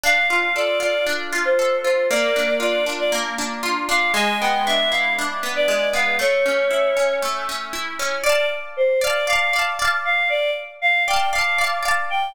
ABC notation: X:1
M:4/4
L:1/16
Q:1/4=117
K:Dm
V:1 name="Choir Aahs"
f2 f2 d2 d2 z3 c3 c2 | d4 d2 z d z6 f2 | ^g2 =g2 e2 f2 z3 d3 f2 | ^c8 z8 |
d2 z2 c2 d2 f3 z3 f2 | d2 z2 f2 g2 f3 z3 g2 |]
V:2 name="Acoustic Guitar (steel)"
D2 F2 A2 F2 D2 F2 A2 F2 | B,2 D2 F2 D2 B,2 D2 F2 D2 | ^G,2 =B,2 D2 E2 D2 B,2 G,2 B,2 | A,2 ^C2 E2 C2 A,2 C2 E2 C2 |
[dfa]6 [dfa]2 [dfa]2 [dfa]2 [dfa]4- | [dfa]6 [dfa]2 [dfa]2 [dfa]2 [dfa]4 |]